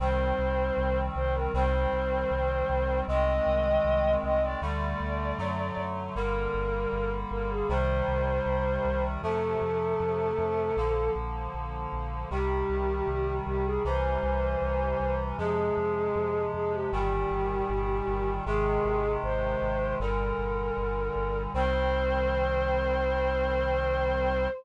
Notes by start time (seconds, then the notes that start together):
0.00 C2 D#3 G3 C4 C5
0.38 C2
0.77 C2
1.15 C2 C5
1.35 A#4
1.54 C2 D#3 G3 C4 C5
1.92 C2
2.31 C2
2.69 C2
3.08 C2 D#3 G#3 C4 D#5
3.46 C2
3.85 C2
4.23 C2 D#5
4.42 D5
4.62 D2 D3 G3 A3 D5
5.00 D2
5.38 F#2 D3 F#3 A3
5.77 F#2
6.15 G1 D3 G3 A#3 A#4
6.54 G1
6.92 G1
7.31 G1 A#4
7.50 G#4
7.69 C2 C3 D#3 G3 C5
8.08 C2
8.46 C2
8.85 C2
9.23 F2 C3 F3 A3 A4
9.62 F2
10.00 F2
10.38 F2
10.77 A#1 D3 F3 A#3
11.15 A#1
11.54 A#1
11.92 A#1
12.30 C2 C3 D#3 G3 G4
12.69 C2
13.08 C2
13.46 C2 G4
13.65 G#4
13.85 C2 C3 E3 G3 C5
14.23 C2
14.62 C2
15.00 C2
15.38 F2 C3 F3 G#3 G#4
15.77 F2
16.15 F2
16.54 F2 G#4
16.73 G4
16.92 G1 A#2 D#3 G3 G4
17.31 G1
17.69 G1
18.08 G1
18.46 G#1 C3 D#3 G#3 G#4
18.85 G#1
19.23 G#1 C5
19.62 G#1
20.00 G1 A#2 D3 G3 A#4
20.38 G1
20.77 G1
21.15 G1
21.54 C2 D#3 G3 C4 C5